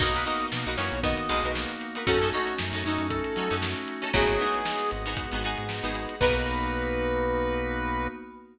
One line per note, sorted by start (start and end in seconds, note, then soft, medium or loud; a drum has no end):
0.00 0.24 B1 medium
0.00 0.63 F#3 loud
0.00 0.47 A#3 medium
0.00 2.05 A#3 medium
0.00 0.47 B3 medium
0.00 2.05 B3 medium
0.00 0.47 D#4 medium
0.00 0.63 D#4 loud
0.00 2.05 D#4 medium
0.00 0.12 D#4 loud
0.00 0.47 F#4 medium
0.00 2.05 F#4 medium
0.00 0.12 F#4 medium
0.00 0.12 A#4 medium
0.00 0.12 B4 loud
0.00 0.24 D#5 medium
0.00 kick loud
0.00 crash loud
0.14 0.24 D#4 medium
0.14 0.24 F#4 medium
0.14 0.24 A#4 medium
0.14 0.24 B4 medium
0.14 snare soft
0.14 closed hi-hat medium
0.25 0.58 D#4 medium
0.25 0.58 F#4 medium
0.25 0.58 A#4 medium
0.25 0.58 B4 medium
0.25 0.46 D#5 medium
0.25 closed hi-hat medium
0.40 closed hi-hat medium
0.51 0.65 B2 medium
0.51 0.98 A#3 medium
0.51 0.98 B3 medium
0.51 0.98 D#4 medium
0.51 0.98 F#4 medium
0.51 snare loud
0.66 0.77 B1 medium
0.66 0.76 D#4 medium
0.66 0.76 F#4 medium
0.66 0.76 A#4 medium
0.66 0.76 B4 medium
0.66 closed hi-hat medium
0.78 0.91 F#2 medium
0.78 1.00 E3 medium
0.78 1.00 C#4 medium
0.78 1.20 D#4 medium
0.78 1.20 F#4 medium
0.78 1.20 A#4 medium
0.78 1.20 B4 medium
0.78 1.00 C#5 medium
0.78 closed hi-hat medium
0.92 1.15 B1 medium
0.92 closed hi-hat medium
1.03 1.28 D#3 medium
1.03 1.51 A#3 medium
1.03 1.28 B3 medium
1.03 1.51 B3 medium
1.03 1.51 D#4 medium
1.03 1.51 F#4 medium
1.03 1.52 D#5 medium
1.03 kick loud
1.03 closed hi-hat loud
1.17 closed hi-hat medium
1.29 1.43 B1 medium
1.29 1.76 B2 medium
1.29 1.76 G#3 medium
1.29 1.40 D#4 medium
1.29 1.40 F#4 medium
1.29 1.40 A#4 medium
1.29 1.40 B4 medium
1.29 closed hi-hat medium
1.43 1.66 B1 medium
1.43 1.84 D#4 medium
1.43 1.84 F#4 medium
1.43 1.84 A#4 medium
1.43 1.84 B4 medium
1.43 closed hi-hat medium
1.55 2.02 A#3 medium
1.55 2.02 B3 medium
1.55 2.02 D#4 medium
1.55 2.02 F#4 medium
1.55 snare loud
1.69 closed hi-hat medium
1.81 closed hi-hat medium
1.95 2.05 D#4 medium
1.95 2.05 F#4 medium
1.95 2.05 A#4 medium
1.95 2.05 B4 medium
1.95 closed hi-hat medium
2.07 2.31 F#2 medium
2.07 2.54 A3 medium
2.07 3.89 A3 medium
2.07 4.12 A3 medium
2.07 2.54 C#4 medium
2.07 2.19 C#4 loud
2.07 4.12 C#4 medium
2.07 2.54 D#4 medium
2.07 4.12 D#4 medium
2.07 2.19 D#4 loud
2.07 2.54 F#4 medium
2.07 3.89 F#4 loud
2.07 4.12 F#4 medium
2.07 2.19 F#4 loud
2.07 2.29 A4 medium
2.07 2.19 A4 loud
2.07 kick loud
2.07 closed hi-hat loud
2.21 2.31 C#4 medium
2.21 2.31 D#4 medium
2.21 2.31 F#4 medium
2.21 2.31 A4 medium
2.21 closed hi-hat medium
2.33 2.65 C#4 medium
2.33 2.65 D#4 medium
2.33 2.55 F#4 medium
2.33 2.65 F#4 medium
2.33 2.65 A4 medium
2.33 snare soft
2.33 closed hi-hat medium
2.47 closed hi-hat medium
2.58 2.72 F#2 medium
2.58 3.06 A3 medium
2.58 3.06 C#4 medium
2.58 3.06 D#4 medium
2.58 3.06 F#4 medium
2.58 snare loud
2.73 2.83 F#2 medium
2.73 2.83 C#4 medium
2.73 2.83 D#4 loud
2.73 2.83 F#4 medium
2.73 2.83 A4 medium
2.73 closed hi-hat medium
2.84 2.98 F#2 medium
2.84 3.28 C#4 medium
2.84 3.07 D#4 medium
2.84 3.28 D#4 medium
2.84 3.28 F#4 medium
2.84 3.28 A4 medium
2.84 closed hi-hat medium
2.98 3.22 F#2 medium
2.98 closed hi-hat medium
3.08 3.58 A3 medium
3.08 3.58 C#4 medium
3.08 3.58 D#4 medium
3.08 3.58 F#4 medium
3.08 3.56 A4 medium
3.08 kick loud
3.08 closed hi-hat loud
3.24 closed hi-hat medium
3.36 3.50 F#3 medium
3.36 3.48 C#4 medium
3.36 3.48 D#4 medium
3.36 3.48 F#4 medium
3.36 3.48 A4 medium
3.36 closed hi-hat medium
3.50 3.74 F#2 medium
3.50 3.91 C#4 medium
3.50 3.91 D#4 medium
3.50 3.91 F#4 medium
3.50 3.91 A4 medium
3.50 snare soft
3.50 closed hi-hat medium
3.62 4.09 A3 medium
3.62 4.09 C#4 medium
3.62 4.09 D#4 medium
3.62 4.09 F#4 medium
3.62 snare loud
3.76 closed hi-hat medium
3.88 closed hi-hat medium
4.02 4.11 C#4 medium
4.02 4.11 D#4 medium
4.02 4.11 F#4 medium
4.02 4.11 A4 medium
4.02 closed hi-hat medium
4.13 4.38 G#1 loud
4.13 5.37 A2 loud
4.13 5.37 F#3 loud
4.13 4.61 G#3 medium
4.13 4.61 B3 medium
4.13 4.35 B3 loud
4.13 4.61 D#4 medium
4.13 4.35 D#4 loud
4.13 4.61 F#4 medium
4.13 4.35 F#4 loud
4.13 6.19 G#4 medium
4.13 4.90 G#4 medium
4.13 4.35 G#4 loud
4.13 6.19 B4 medium
4.13 6.19 D#5 medium
4.13 6.19 F#5 medium
4.13 kick loud
4.13 closed hi-hat loud
4.28 closed hi-hat medium
4.40 4.83 B3 medium
4.40 4.83 D#4 medium
4.40 4.83 F#4 medium
4.40 4.83 G#4 medium
4.40 closed hi-hat medium
4.54 closed hi-hat medium
4.65 5.13 G#3 medium
4.65 5.13 B3 medium
4.65 5.13 D#4 medium
4.65 5.13 F#4 medium
4.65 snare loud
4.80 closed hi-hat medium
4.91 5.16 G#1 medium
4.91 closed hi-hat medium
5.06 5.26 B3 medium
5.06 5.26 D#4 medium
5.06 5.26 F#4 medium
5.06 5.26 G#4 medium
5.06 closed hi-hat medium
5.17 5.64 G#3 medium
5.17 5.64 B3 medium
5.17 5.64 D#4 medium
5.17 5.64 F#4 medium
5.17 kick loud
5.17 closed hi-hat loud
5.32 5.56 G#1 medium
5.32 5.42 B3 medium
5.32 5.42 D#4 medium
5.32 5.42 F#4 medium
5.32 5.42 G#4 medium
5.32 closed hi-hat medium
5.43 5.76 B3 medium
5.43 5.76 D#4 medium
5.43 5.76 F#4 medium
5.43 5.76 G#4 medium
5.43 closed hi-hat medium
5.58 5.81 G#2 medium
5.58 closed hi-hat medium
5.68 6.16 G#3 medium
5.68 6.16 B3 medium
5.68 6.16 D#4 medium
5.68 6.16 F#4 medium
5.68 snare loud
5.83 6.07 G#1 medium
5.83 6.14 B3 medium
5.83 6.14 D#4 medium
5.83 6.14 F#4 medium
5.83 6.14 G#4 medium
5.83 closed hi-hat medium
5.95 closed hi-hat loud
6.09 closed hi-hat medium
6.20 8.08 B1 loud
6.20 8.07 A#3 loud
6.20 8.08 A#3 medium
6.20 8.07 B3 loud
6.20 8.08 B3 medium
6.20 8.08 B3 loud
6.20 8.07 D#4 loud
6.20 8.08 D#4 loud
6.20 8.07 F#4 loud
6.20 8.08 F#4 loud
6.20 8.08 A#4 loud
6.20 8.07 B4 loud
6.20 8.08 B4 loud
6.20 kick loud
6.20 crash loud